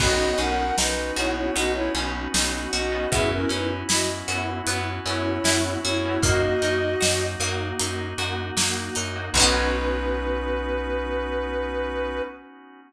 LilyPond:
<<
  \new Staff \with { instrumentName = "Ocarina" } { \time 4/4 \key b \major \tempo 4 = 77 <fis' dis''>8 <ais' fis''>8 <dis' b'>8 <e' cis''>16 <e' cis''>16 <fis' dis''>16 <e' cis''>16 r4 <fis' dis''>8 | <gis' e''>16 <cis' ais'>16 <dis' b'>16 r16 <fis' dis''>16 r4 r16 <e' cis''>4 <e' cis''>8 | <fis' dis''>4. r2 r8 | b'1 | }
  \new Staff \with { instrumentName = "Electric Piano 2" } { \time 4/4 \key b \major <b cis' dis' fis'>4. <b cis' dis' fis'>4 <b cis' dis' fis'>8 <b cis' dis' fis'>8. <b cis' dis' fis'>16 | <b cis' e' fis'>4. <b cis' e' fis'>4 <b cis' e' fis'>8 <b cis' e' fis'>8. <b cis' e' fis'>16 | <ais dis' fis'>4. <ais dis' fis'>4 <ais dis' fis'>8 <ais dis' fis'>8. <ais dis' fis'>16 | <b cis' dis' fis'>1 | }
  \new Staff \with { instrumentName = "Pizzicato Strings" } { \time 4/4 \key b \major b8 cis'8 dis'8 fis'8 b8 cis'8 dis'8 fis'8 | b8 cis'8 e'8 fis'8 b8 cis'8 e'8 fis'8 | ais8 dis'8 fis'8 ais8 dis'8 fis'8 ais8 dis'8 | <b cis' dis' fis'>1 | }
  \new Staff \with { instrumentName = "Electric Bass (finger)" } { \clef bass \time 4/4 \key b \major b,,8 b,,8 b,,8 b,,8 b,,8 b,,8 b,,8 b,,8 | fis,8 fis,8 fis,8 fis,8 fis,8 fis,8 fis,8 fis,8 | fis,8 fis,8 fis,8 fis,8 fis,8 fis,8 fis,8 fis,8 | b,,1 | }
  \new Staff \with { instrumentName = "Drawbar Organ" } { \time 4/4 \key b \major <b cis' dis' fis'>1 | <b cis' e' fis'>1 | <ais dis' fis'>1 | <b cis' dis' fis'>1 | }
  \new DrumStaff \with { instrumentName = "Drums" } \drummode { \time 4/4 <cymc bd>8 hh8 sn8 hh8 hh8 hh8 sn8 hh8 | <hh bd>8 hh8 sn8 hh8 hh8 hh8 sn8 hh8 | <hh bd>8 hh8 sn8 hh8 hh8 hh8 sn8 hh8 | <cymc bd>4 r4 r4 r4 | }
>>